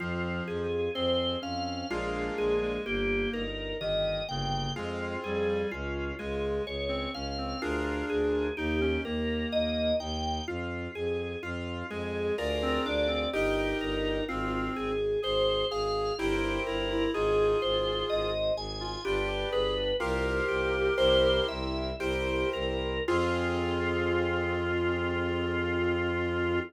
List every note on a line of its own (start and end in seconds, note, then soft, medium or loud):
0.00 0.41 F2 medium
0.00 0.66 F3 medium
0.00 0.43 C4 medium
0.00 0.44 F4 medium
0.48 0.89 F2 medium
0.48 0.90 F4 medium
0.48 0.91 G#4 medium
0.94 1.36 F2 medium
0.94 1.36 C4 medium
0.94 1.38 G#4 medium
0.94 1.39 C5 medium
1.42 1.84 F2 medium
1.42 1.86 C4 medium
1.42 1.87 C#4 medium
1.42 1.87 F5 medium
1.90 2.30 A#1 medium
1.90 2.34 G#3 medium
1.90 2.76 A#3 medium
1.90 2.76 D4 medium
1.90 2.34 F4 medium
1.90 2.76 F4 loud
1.90 2.76 G#4 medium
2.38 2.79 A#1 medium
2.38 2.60 G#3 medium
2.38 2.82 G#4 medium
2.62 2.84 G#3 medium
2.85 3.27 G1 medium
2.85 3.43 A#3 medium
2.85 3.29 A#3 medium
2.85 3.30 G4 medium
3.33 3.73 G1 medium
3.33 3.76 D#4 medium
3.33 3.77 A#4 medium
3.81 4.21 G1 medium
3.81 4.22 D#3 medium
3.81 4.24 G4 medium
3.81 4.25 D#5 medium
4.29 4.69 G1 medium
4.29 4.73 C#3 medium
4.29 4.72 A#3 medium
4.29 4.72 G5 medium
4.76 5.17 F2 medium
4.76 5.17 G#3 medium
4.76 5.62 C4 medium
4.76 5.20 F4 medium
4.76 5.62 F4 medium
4.76 5.62 G#4 medium
5.24 5.64 F2 medium
5.24 5.48 G3 medium
5.24 5.68 G#4 medium
5.48 5.71 G3 medium
5.71 6.12 C#2 medium
5.71 6.14 C#4 loud
5.71 6.15 F4 medium
6.19 6.60 C#2 medium
6.19 6.65 G#3 medium
6.19 6.62 F4 medium
6.19 6.63 G#4 medium
6.66 7.07 C#2 medium
6.66 7.10 G#4 medium
6.66 7.11 C#5 medium
6.88 7.11 C4 medium
7.14 7.54 C#2 medium
7.14 7.37 C#4 medium
7.14 7.57 C#4 medium
7.14 7.58 F5 medium
7.38 7.61 C4 medium
7.62 8.03 D2 medium
7.62 8.48 D4 medium
7.62 8.06 F4 medium
7.62 8.48 F4 medium
7.62 8.48 G#4 medium
7.62 8.48 A#4 medium
8.10 8.50 D2 medium
8.10 8.53 G#4 medium
8.57 8.98 D#2 medium
8.57 8.80 D#4 medium
8.57 9.00 D#4 medium
8.57 9.01 G4 medium
8.81 9.03 C#4 medium
9.05 9.45 D#2 medium
9.05 9.92 A#3 medium
9.05 9.48 G4 medium
9.05 9.49 A#4 medium
9.52 9.93 D#2 medium
9.52 9.95 A#4 medium
9.52 9.96 D#5 medium
10.00 10.40 D#2 medium
10.00 10.43 D#4 medium
10.00 10.44 G5 medium
10.47 10.88 F2 medium
10.47 10.90 F4 medium
10.47 10.91 F4 medium
10.95 11.36 F2 medium
10.95 11.39 G#4 medium
10.95 11.38 G#4 medium
11.42 11.83 F2 medium
11.42 11.86 F4 medium
11.42 11.87 F4 medium
11.90 12.31 F2 medium
11.90 12.36 G#3 medium
11.90 12.33 G#4 medium
11.90 12.34 G#4 medium
12.38 12.79 D2 medium
12.38 13.24 F4 medium
12.38 13.24 G#4 medium
12.38 13.24 A#4 medium
12.38 12.82 A#4 medium
12.38 13.24 D5 medium
12.62 12.85 C4 loud
12.85 13.26 D2 medium
12.85 13.08 D4 medium
12.85 13.30 D5 medium
13.08 13.30 C4 medium
13.33 13.74 G1 medium
13.33 14.24 D#4 medium
13.33 13.77 G4 medium
13.33 14.19 G4 medium
13.33 14.19 A#4 medium
13.33 14.19 D#5 medium
13.81 14.21 G1 medium
13.81 14.25 A#4 medium
14.28 14.69 G#1 medium
14.28 14.92 C4 medium
14.28 14.71 F4 medium
14.28 14.72 F4 medium
14.76 15.17 G#1 medium
14.76 15.19 G#4 medium
14.76 15.20 G#4 medium
15.22 15.64 G#1 medium
15.22 15.65 G#4 medium
15.22 15.67 C5 medium
15.70 16.12 G#1 medium
15.70 16.13 G#4 medium
15.70 16.14 G#4 medium
15.70 16.15 F5 medium
16.18 16.59 G1 medium
16.18 16.60 E4 medium
16.18 17.05 E4 loud
16.18 16.63 G4 medium
16.18 17.05 G4 medium
16.18 17.05 A#4 loud
16.18 17.05 C5 medium
16.67 17.07 G1 medium
16.67 16.89 E4 medium
16.67 17.11 A#4 medium
16.90 17.12 E4 medium
17.14 17.55 G#1 medium
17.14 17.57 D#4 medium
17.14 18.31 F4 medium
17.14 18.31 G#4 medium
17.14 17.58 G#4 medium
17.62 18.03 G#1 medium
17.62 18.05 G#4 medium
17.62 18.06 C5 medium
18.10 18.51 G#1 medium
18.10 18.52 C5 medium
18.10 18.53 D#5 medium
18.56 18.97 G#1 medium
18.56 19.00 G#4 medium
18.56 19.01 G#5 medium
18.80 19.03 F4 medium
19.05 19.45 G1 medium
19.05 19.90 D4 loud
19.05 19.28 F4 medium
19.05 19.49 G4 medium
19.05 19.90 G4 medium
19.05 19.90 B4 medium
19.28 19.50 G4 medium
19.52 19.93 G1 medium
19.52 19.74 G#4 medium
19.52 19.96 B4 medium
20.00 20.41 C2 medium
20.00 20.88 F4 medium
20.00 20.45 F4 medium
20.00 20.88 G4 loud
20.00 21.45 G4 medium
20.00 20.88 A#4 medium
20.00 21.45 A#4 medium
20.00 20.88 C5 medium
20.48 20.90 C2 medium
20.48 20.94 G4 medium
20.97 21.40 C2 medium
20.97 21.90 E4 loud
20.97 21.90 G4 medium
20.97 21.90 A#4 medium
20.97 21.44 C5 medium
20.97 21.90 C5 medium
21.48 21.93 C2 medium
21.48 21.96 E5 medium
21.99 22.44 C2 medium
21.99 22.97 E4 medium
21.99 22.97 G4 medium
21.99 22.49 G4 medium
21.99 22.97 A#4 medium
21.99 22.97 C5 loud
22.53 23.00 C2 medium
22.53 23.03 A#4 medium
23.07 26.60 F2 loud
23.07 26.60 C4 loud
23.07 26.59 F4 loud
23.07 26.60 F4 loud
23.07 26.60 G#4 loud